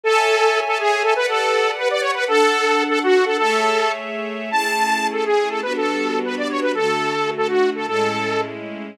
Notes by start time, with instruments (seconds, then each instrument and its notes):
0.03 string ensemble 1 A4 C#5 E5 G#5, lead 2 (sawtooth) A4
0.66 lead 2 (sawtooth) A4
0.79 lead 2 (sawtooth) G#4
1.02 lead 2 (sawtooth) A4
1.15 string ensemble 1 G4 B4 D5 F#5, lead 2 (sawtooth) B4
1.28 lead 2 (sawtooth) A4
1.78 lead 2 (sawtooth) B4
1.91 lead 2 (sawtooth) D5
2.01 lead 2 (sawtooth) C#5
2.14 lead 2 (sawtooth) B4
2.27 string ensemble 1 D4 A4 F#5, lead 2 (sawtooth) A4
2.89 lead 2 (sawtooth) A4
3.03 lead 2 (sawtooth) F#4
3.26 lead 2 (sawtooth) A4
3.38 string ensemble 1 A3 G#4 C#5 E5, lead 2 (sawtooth) A4
4.51 string ensemble 1 A3 C#4 E4 G#4, lead 2 (sawtooth) A5
5.13 lead 2 (sawtooth) A4
5.25 lead 2 (sawtooth) G#4
5.49 lead 2 (sawtooth) A4
5.62 string ensemble 1 G3 B3 D4 F#4, lead 2 (sawtooth) B4
5.76 lead 2 (sawtooth) A4
6.25 lead 2 (sawtooth) B4
6.38 lead 2 (sawtooth) D5
6.50 lead 2 (sawtooth) C#5
6.62 lead 2 (sawtooth) B4
6.75 string ensemble 1 D3 A3 F#4, lead 2 (sawtooth) A4
7.37 lead 2 (sawtooth) A4
7.48 lead 2 (sawtooth) F#4
7.75 lead 2 (sawtooth) A4
7.86 string ensemble 1 A2 G#3 C#4 E4, lead 2 (sawtooth) A4